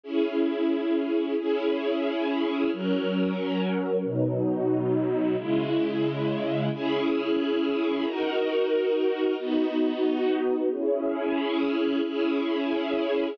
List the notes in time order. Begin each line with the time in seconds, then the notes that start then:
0.03 C#4 E4 G#4
1.39 C#4 E4 G#4
2.73 F#3 C#4 A#4
4.04 B2 F#3 D#4
5.37 C#3 G#3 E4
6.73 C#4 E4 G#4
8.04 D#4 F#4 A#4
9.38 B3 D#4 F#4
10.70 C#4 E4 G#4
12.04 C#4 E4 G#4